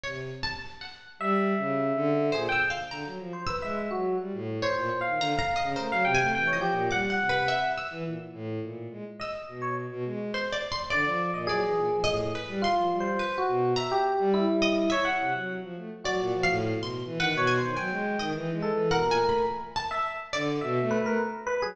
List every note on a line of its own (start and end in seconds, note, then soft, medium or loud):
0.04 0.31 C3 medium
0.04 0.38 C#5 medium
0.43 0.77 A5 medium
0.81 1.15 F#5 soft
1.19 1.54 G3 loud
1.19 2.23 E5 loud
1.58 1.92 C#3 medium
1.95 2.30 D3 loud
2.32 2.47 A#2 medium
2.32 2.47 G#4 medium
2.32 2.49 C5 medium
2.49 2.62 G5 loud
2.49 2.69 E6 medium
2.70 2.87 F5 medium
2.91 3.04 D3 medium
2.91 3.43 A#5 medium
3.05 3.18 F#3 medium
3.19 3.32 F3 medium
3.33 3.46 C5 medium
3.47 3.61 B4 medium
3.47 4.49 E6 medium
3.62 3.88 G#3 medium
3.62 3.75 E5 medium
3.91 4.16 F#3 medium
3.91 4.16 F#4 medium
4.19 4.32 G3 medium
4.33 4.59 A2 medium
4.62 4.97 C5 medium
4.62 4.88 C#5 medium
4.76 4.89 A#2 medium
5.01 5.35 F5 medium
5.05 5.18 D#3 medium
5.19 5.32 D3 medium
5.19 5.38 A#5 loud
5.38 5.72 F5 medium
5.38 5.56 A#5 loud
5.56 5.73 D#5 medium
5.62 5.75 C#3 medium
5.76 5.89 A3 medium
5.76 5.89 A#4 medium
5.76 6.10 C5 medium
5.91 6.04 F#3 medium
5.91 6.05 F5 loud
6.05 6.18 C3 loud
6.05 6.30 G5 loud
6.15 6.49 G#5 loud
6.19 6.32 A3 medium
6.33 6.51 E3 medium
6.33 6.48 G5 loud
6.47 6.60 C#5 medium
6.53 6.70 F3 medium
6.53 6.87 D#5 medium
6.61 6.87 G4 medium
6.72 6.89 A#2 medium
6.91 7.16 G3 medium
6.91 7.69 F#5 loud
6.91 7.08 D6 medium
7.10 7.27 F#5 medium
7.19 7.32 C3 medium
7.29 7.46 B4 medium
7.34 7.47 C3 soft
7.48 7.74 E5 medium
7.78 8.03 E6 medium
7.91 8.04 E3 loud
8.05 8.18 A#2 soft
8.34 8.59 A2 medium
8.62 8.88 A#2 medium
8.91 9.04 G#3 medium
9.20 9.33 D#5 medium
9.20 9.73 E6 medium
9.48 9.86 B2 medium
9.62 9.75 C#5 medium
9.91 10.04 B2 medium
10.05 10.31 G#3 medium
10.34 10.51 C5 medium
10.53 10.70 D5 medium
10.72 10.89 C6 medium
10.90 11.04 D3 medium
10.90 11.42 D5 medium
10.90 11.31 D5 loud
11.05 11.31 F3 medium
11.34 11.46 A#2 medium
11.34 11.47 D#5 medium
11.47 11.61 F#3 medium
11.47 11.98 G#4 loud
11.47 12.01 D5 medium
11.62 11.75 E3 medium
11.76 11.89 A#2 medium
11.91 12.04 F3 medium
12.04 12.31 A2 medium
12.04 12.30 D#5 loud
12.35 12.61 B4 medium
12.48 12.61 G3 loud
12.62 12.96 F4 medium
12.62 12.90 C6 medium
12.76 12.89 F3 medium
12.91 13.16 G3 medium
13.00 13.35 C5 medium
13.19 13.71 B4 medium
13.38 13.72 F#4 medium
13.48 13.74 B2 medium
13.76 13.90 E5 medium
13.76 14.53 A#5 loud
13.92 14.30 G4 loud
14.19 14.45 G3 loud
14.34 14.85 E4 loud
14.48 14.86 G3 medium
14.62 14.88 D#5 loud
14.90 15.04 C#5 medium
14.90 15.15 E5 loud
15.05 15.30 F#5 loud
15.19 15.32 C3 medium
15.33 15.59 F#3 medium
15.62 15.75 F3 medium
15.77 15.90 A3 medium
16.04 16.18 F#3 medium
16.04 16.56 F#4 medium
16.04 16.40 D5 medium
16.19 16.32 A#2 medium
16.34 16.47 F3 medium
16.43 16.78 F5 loud
16.48 16.74 A2 loud
16.76 17.02 B2 medium
16.83 17.17 C6 medium
17.05 17.18 E3 loud
17.19 17.32 D#3 medium
17.19 17.46 B4 medium
17.19 17.37 F#5 loud
17.34 17.59 B2 loud
17.34 17.55 C#5 medium
17.47 17.73 G#5 medium
17.58 17.75 C5 medium
17.62 17.75 D#3 medium
17.76 17.89 F#3 medium
17.76 18.28 G5 medium
17.76 18.15 G#5 medium
17.91 18.16 G#3 loud
18.19 18.32 D#3 medium
18.19 18.32 D#5 medium
18.33 18.51 E3 loud
18.53 18.70 G#3 loud
18.62 18.88 A4 medium
18.72 18.89 E3 medium
18.91 19.04 B2 medium
18.91 19.43 A#4 loud
18.91 19.08 F#5 medium
19.05 19.18 A#2 medium
19.11 19.28 G#5 loud
19.19 19.45 A3 medium
19.29 19.46 B5 medium
19.76 20.27 A5 loud
19.91 20.04 E5 medium
20.33 20.59 D3 loud
20.33 20.59 D5 loud
20.61 20.79 B2 loud
20.61 20.87 E5 medium
20.81 20.98 A3 loud
20.91 21.04 B4 loud
21.00 21.18 A3 loud
21.06 21.19 A#4 medium
21.47 21.59 B4 loud
21.62 21.75 F#3 medium
21.62 21.75 G#4 loud